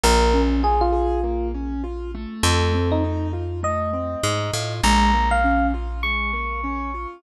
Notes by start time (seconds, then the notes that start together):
0.04 A#1 A#3 A#4
0.34 C#4
0.63 F4 G#4
0.81 F4
0.92 G#4
1.24 A#3
1.54 C#4
1.84 F4
2.15 A3
2.43 F2 A4
2.74 C4
2.92 D#4
3.04 D#4
3.33 F4
3.63 A3 D#5
3.93 C4
4.24 G#2 D#4
4.54 A2 F4
4.83 A#1 G#3 A#5
5.13 A#3
5.31 F5
5.44 C#4
5.74 F4
6.03 G#3 C#6
6.33 A#3
6.64 C#4
6.94 F4